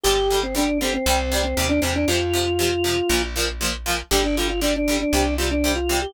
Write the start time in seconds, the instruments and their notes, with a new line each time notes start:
0.03 electric bass (finger) G1, acoustic guitar (steel) D3 G3, drawbar organ G4
0.30 acoustic guitar (steel) D3 G3
0.43 drawbar organ C4
0.55 acoustic guitar (steel) D3 G3, drawbar organ D4
0.81 acoustic guitar (steel) D3 G3, drawbar organ C4
0.94 drawbar organ C4
1.06 electric bass (finger) C2, acoustic guitar (steel) C3 G3
1.32 acoustic guitar (steel) C3 G3
1.44 drawbar organ C4
1.57 electric bass (finger) D#2, acoustic guitar (steel) C3 G3
1.69 drawbar organ D4
1.81 electric bass (finger) E2, acoustic guitar (steel) C3 G3, drawbar organ C4
1.96 drawbar organ D4
2.08 electric bass (finger) F2, acoustic guitar (steel) C3 F3, drawbar organ F4
2.33 acoustic guitar (steel) C3 F3
2.59 acoustic guitar (steel) C3 F3
2.84 acoustic guitar (steel) C3 F3
3.09 electric bass (finger) A#1, acoustic guitar (steel) A#2 F3
3.36 acoustic guitar (steel) A#2 F3
3.61 acoustic guitar (steel) A#2 F3
3.86 acoustic guitar (steel) A#2 F3
4.11 electric bass (finger) G1, acoustic guitar (steel) D3 G3, drawbar organ G4
4.24 drawbar organ D4
4.37 acoustic guitar (steel) D3 G3, drawbar organ F4
4.48 drawbar organ F4
4.61 acoustic guitar (steel) D3 G3, drawbar organ D4
4.76 drawbar organ D4
4.88 acoustic guitar (steel) D3 G3
5.00 drawbar organ D4
5.13 electric bass (finger) C2, acoustic guitar (steel) C3 G3
5.38 acoustic guitar (steel) C3 G3, drawbar organ F4
5.51 drawbar organ D4
5.64 acoustic guitar (steel) C3 G3
5.75 drawbar organ F4
5.89 acoustic guitar (steel) C3 G3
6.02 drawbar organ G4